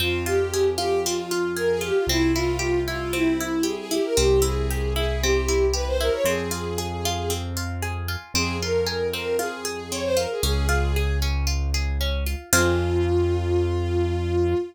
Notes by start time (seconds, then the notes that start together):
0.00 F2 C4 F4
0.26 F4 G4
0.54 G#4
0.78 F4 G4
1.04 C4 F4
1.31 F4
1.57 G#4 A#4
1.70 G#4
1.81 F4 G4
1.95 F4
2.07 C2 C4 E4
2.35 E4 F4
2.59 G4
2.87 E4 F4
3.13 C4 E4
3.40 E4
3.63 G4 G#4
3.77 G#4
3.91 E4 G4
4.04 A#4
4.17 C2 C4 G4
4.42 E4 G#4
4.71 G4
4.96 E4 G#4
5.22 C4 G4
5.48 E4
5.73 G4 B4
5.87 C5
6.01 E4 A#4
6.13 C#5
6.24 F2 C4 G#4
6.51 F4
6.78 G#4
7.05 F4
7.30 C4
7.57 F4
7.82 G#4
8.08 F4
8.34 F2 C4 G#4
8.61 F4 A#4
8.87 G#4
9.13 C4 A#4
9.39 F4 G#4
9.65 G#4
9.91 C4 C#5
10.04 C5
10.17 F4 A#4
10.31 G#4
10.43 C#2 C#4 G#4
10.69 F4
10.96 G#4
11.22 C#4
11.47 F4
11.74 G#4
12.01 C#4
12.26 F4
12.52 F2 C4 F4 G#4